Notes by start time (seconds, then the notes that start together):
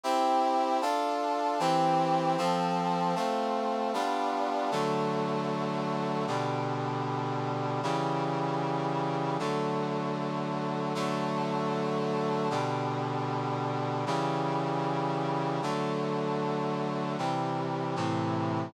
0.03 C4 E4 G4
0.82 D4 F4 A4
1.59 E3 C4 G4
2.38 F3 C4 A4
3.15 A3 C4 F4
3.94 G3 B3 D4 F4
4.71 D3 F#3 A3
6.27 B2 D3 G3
7.83 C#3 E3 G3
9.39 D3 F#3 A3
10.95 D3 F#3 A3
12.50 B2 D3 G3
14.06 C#3 E3 G3
15.62 D3 F#3 A3
17.18 C3 E3 G3
17.96 A2 C3 E3